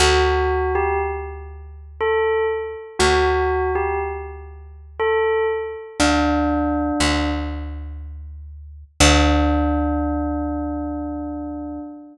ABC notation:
X:1
M:3/4
L:1/16
Q:1/4=60
K:Dmix
V:1 name="Tubular Bells"
F3 G z4 A2 z2 | F3 G z4 A2 z2 | D6 z6 | D12 |]
V:2 name="Electric Bass (finger)" clef=bass
D,,12 | D,,12 | D,,4 D,,8 | D,,12 |]